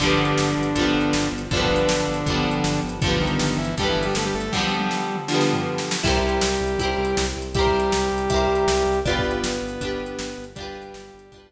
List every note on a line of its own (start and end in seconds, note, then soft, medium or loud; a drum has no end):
0.00 0.17 G1 medium
0.00 0.68 D3 loud
0.00 1.28 D3 medium
0.00 0.68 F3 medium
0.00 0.68 G3 medium
0.00 1.28 D4 loud
0.00 kick loud
0.00 crash loud
0.06 0.68 B3 medium
0.18 0.35 G1 medium
0.25 closed hi-hat medium
0.38 0.54 G1 medium
0.38 snare loud
0.57 0.73 G1 medium
0.63 closed hi-hat medium
0.75 0.91 G1 medium
0.75 1.43 D3 medium
0.75 1.43 F3 medium
0.75 1.43 G3 medium
0.75 kick medium
0.75 closed hi-hat loud
0.81 1.43 B3 medium
0.94 1.10 G1 medium
1.00 closed hi-hat medium
1.13 1.29 G1 medium
1.13 snare loud
1.32 1.48 G1 medium
1.38 closed hi-hat medium
1.51 1.67 G1 medium
1.51 2.19 D3 medium
1.51 2.80 D3 loud
1.51 2.19 F3 medium
1.51 2.19 G3 loud
1.51 2.80 D4 loud
1.51 kick loud
1.51 closed hi-hat loud
1.57 2.19 B3 loud
1.64 kick loud
1.69 1.85 G1 medium
1.76 closed hi-hat loud
1.88 2.04 G1 medium
1.88 snare loud
2.08 2.24 G1 medium
2.14 closed hi-hat medium
2.26 2.42 G1 medium
2.26 2.94 D3 medium
2.26 2.94 F3 medium
2.26 2.94 G3 medium
2.26 kick loud
2.26 closed hi-hat loud
2.32 2.94 B3 medium
2.45 2.61 G1 medium
2.51 closed hi-hat medium
2.64 2.80 G1 medium
2.64 snare loud
2.83 3.00 G1 medium
2.89 closed hi-hat medium
3.01 3.18 G1 medium
3.01 3.70 D3 medium
3.01 3.18 F3 medium
3.01 3.70 F3 loud
3.01 3.18 F4 loud
3.01 kick loud
3.01 closed hi-hat loud
3.06 3.70 G3 medium
3.06 3.70 B3 medium
3.14 kick loud
3.20 3.36 G1 medium
3.20 3.58 D#3 medium
3.20 3.58 D#4 loud
3.27 closed hi-hat medium
3.39 3.56 G1 medium
3.39 snare loud
3.58 3.74 G1 medium
3.58 3.75 E3 medium
3.58 3.75 E4 loud
3.65 closed hi-hat medium
3.77 3.93 G1 medium
3.77 4.45 D3 medium
3.77 4.45 F3 medium
3.77 3.88 G3 loud
3.77 4.45 G3 medium
3.77 3.88 G4 loud
3.77 kick loud
3.77 closed hi-hat loud
3.83 4.45 B3 medium
3.88 4.05 E3 medium
3.88 4.05 E4 medium
3.96 4.12 G1 medium
4.03 4.14 G3 medium
4.03 4.14 G4 loud
4.03 closed hi-hat medium
4.15 4.31 G1 medium
4.15 4.25 A3 medium
4.15 4.25 A4 medium
4.15 snare loud
4.25 4.34 G3 medium
4.25 4.34 G4 medium
4.34 4.50 G1 medium
4.34 4.52 A3 medium
4.34 4.52 A4 loud
4.40 closed hi-hat medium
4.51 5.21 D3 medium
4.51 5.21 F3 loud
4.51 5.16 G3 medium
4.51 5.16 G4 medium
4.51 kick medium
4.51 snare medium
4.57 5.21 G3 medium
4.57 5.21 B3 loud
4.78 high tom loud
4.91 snare medium
5.16 mid tom medium
5.28 5.96 D3 medium
5.28 5.96 F3 medium
5.28 5.96 G3 medium
5.28 snare loud
5.34 5.96 B3 medium
5.41 snare loud
5.53 floor tom loud
5.78 snare loud
5.91 snare loud
6.03 6.20 C2 medium
6.03 7.25 G3 loud
6.03 6.71 E4 medium
6.03 7.25 G4 loud
6.03 6.71 G4 medium
6.03 6.71 A#4 loud
6.03 kick loud
6.03 crash loud
6.09 6.71 C5 medium
6.16 kick medium
6.22 6.39 C2 medium
6.29 closed hi-hat medium
6.41 6.58 C2 medium
6.41 snare loud
6.60 6.76 C2 medium
6.67 closed hi-hat medium
6.78 6.94 C2 medium
6.78 7.47 E4 medium
6.78 7.47 G4 medium
6.78 kick loud
6.78 closed hi-hat loud
6.83 7.47 A#4 medium
6.83 7.47 C5 medium
6.98 7.14 C2 medium
7.05 closed hi-hat medium
7.17 7.33 C2 medium
7.17 snare loud
7.37 7.53 C2 medium
7.42 closed hi-hat medium
7.54 7.70 C2 medium
7.54 9.00 G3 loud
7.54 8.23 E4 medium
7.54 9.00 G4 loud
7.54 8.23 G4 medium
7.54 kick loud
7.54 closed hi-hat loud
7.59 8.23 A#4 loud
7.59 8.23 C5 medium
7.67 kick loud
7.74 7.90 C2 medium
7.80 closed hi-hat medium
7.92 8.08 C2 medium
7.92 snare loud
8.12 8.28 C2 medium
8.18 closed hi-hat medium
8.30 8.47 C2 medium
8.30 8.98 E4 medium
8.30 8.98 G4 medium
8.30 kick loud
8.30 closed hi-hat loud
8.34 8.98 A#4 medium
8.34 8.98 C5 medium
8.48 8.64 C2 medium
8.55 closed hi-hat medium
8.67 8.83 C2 medium
8.67 snare loud
8.86 9.02 C2 medium
8.93 closed hi-hat medium
9.05 9.21 G1 medium
9.05 10.45 B3 loud
9.05 9.73 D4 medium
9.05 9.73 F4 medium
9.05 10.45 B4 loud
9.05 kick loud
9.05 closed hi-hat loud
9.09 9.73 G4 loud
9.09 9.73 B4 medium
9.18 kick loud
9.24 9.40 G1 medium
9.31 closed hi-hat medium
9.43 9.59 G1 medium
9.43 snare loud
9.62 9.78 G1 medium
9.69 closed hi-hat medium
9.81 9.97 G1 medium
9.81 10.49 D4 medium
9.81 10.49 F4 medium
9.81 kick loud
9.81 closed hi-hat loud
9.85 10.49 G4 medium
9.85 10.49 B4 medium
10.00 10.16 G1 medium
10.06 closed hi-hat medium
10.19 10.35 G1 medium
10.19 snare loud
10.38 10.54 G1 medium
10.44 closed hi-hat medium
10.55 10.73 G1 medium
10.55 11.46 G3 loud
10.55 11.25 D4 loud
10.55 11.25 F4 medium
10.55 11.46 G4 loud
10.55 kick loud
10.55 closed hi-hat loud
10.61 11.25 G4 medium
10.61 11.25 B4 medium
10.75 10.91 G1 medium
10.82 closed hi-hat medium
10.94 11.10 G1 medium
10.94 snare loud
11.14 11.30 G1 medium
11.19 closed hi-hat loud
11.32 11.48 G1 medium
11.32 11.52 D4 medium
11.32 11.52 F4 medium
11.32 kick loud
11.32 closed hi-hat loud
11.36 11.52 G4 medium
11.36 11.52 B4 medium
11.50 11.52 G1 medium